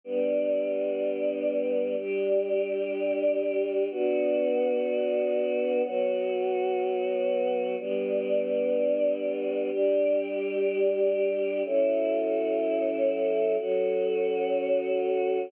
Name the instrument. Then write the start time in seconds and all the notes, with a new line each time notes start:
choir aahs
0.04 G3 B3 D4
1.97 G3 D4 G4
3.91 B3 D4 F#4
5.84 F#3 B3 F#4
7.79 G3 B3 D4
9.71 G3 D4 G4
11.65 F#3 C#4 E4 A4
13.58 F#3 C#4 F#4 A4